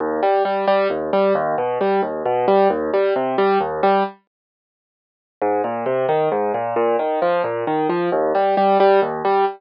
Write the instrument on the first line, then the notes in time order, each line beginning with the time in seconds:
acoustic grand piano
0.00 D#2
0.23 G3
0.45 G3
0.67 G3
0.90 D#2
1.13 G3
1.35 D#2
1.58 B2
1.81 G3
2.03 D#2
2.26 B2
2.48 G3
2.70 D#2
2.94 G3
3.16 C3
3.38 G3
3.61 D#2
3.83 G3
5.42 G#2
5.64 A#2
5.86 C3
6.09 D#3
6.32 G#2
6.54 A#2
6.76 A#2
6.99 D#3
7.22 F3
7.44 A#2
7.67 D#3
7.89 F3
8.12 D#2
8.35 G3
8.57 G3
8.80 G3
9.02 D#2
9.25 G3